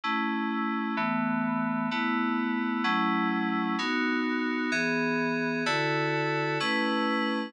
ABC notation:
X:1
M:6/8
L:1/8
Q:3/8=128
K:E
V:1 name="Electric Piano 2"
[A,CE]6 | [E,A,B,]6 | [A,B,E]6 | [F,A,CE]6 |
[B,DF]6 | [E,B,G]6 | [=D,EFA]6 | [A,CEB]6 |]